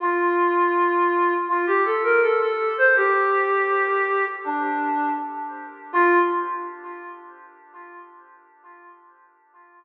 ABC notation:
X:1
M:4/4
L:1/16
Q:1/4=81
K:Fmix
V:1 name="Ocarina"
F8 F G A B A A2 c | G8 D4 z4 | F4 z12 |]